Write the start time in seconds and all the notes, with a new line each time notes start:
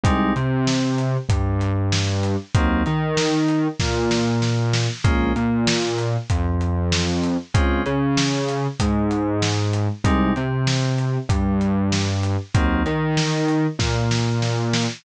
0.04 C2 G3 G#3 C4 D#4, kick, closed hi-hat
0.36 C3 C4, closed hi-hat
0.67 snare
0.98 closed hi-hat
1.29 G2 G3, kick, closed hi-hat
1.61 closed hi-hat
1.92 snare
2.23 closed hi-hat
2.55 D#2 F#3 A#3 C4 D#4, kick, closed hi-hat
2.86 D#3 D#4, closed hi-hat
3.17 snare
3.48 closed hi-hat
3.80 A#2 A#3, kick, snare
4.11 snare
4.42 snare
4.73 snare
5.04 A#1 G#3 A#3 C#4 F4, kick, closed hi-hat
5.36 A#2 A#3, closed hi-hat
5.67 snare
5.98 closed hi-hat
6.30 F2 F3, kick, closed hi-hat
6.61 closed hi-hat
6.92 snare
7.24 closed hi-hat
7.54 C#2 G#3 C4 C#4 F4, kick, closed hi-hat
7.85 C#3 C#4, closed hi-hat
8.17 snare
8.49 closed hi-hat
8.80 G#2 G#3, kick, closed hi-hat
9.11 closed hi-hat
9.42 snare
9.73 closed hi-hat
10.04 C2 G3 G#3 C4 D#4, kick, closed hi-hat
10.36 C3 C4, closed hi-hat
10.67 snare
10.98 closed hi-hat
11.29 G2 G3, kick, closed hi-hat
11.61 closed hi-hat
11.92 snare
12.23 closed hi-hat
12.54 D#2 F#3 A#3 C4 D#4, kick, closed hi-hat
12.85 D#3 D#4, closed hi-hat
13.17 snare
13.48 closed hi-hat
13.79 A#2 A#3, kick, snare
14.11 snare
14.42 snare
14.73 snare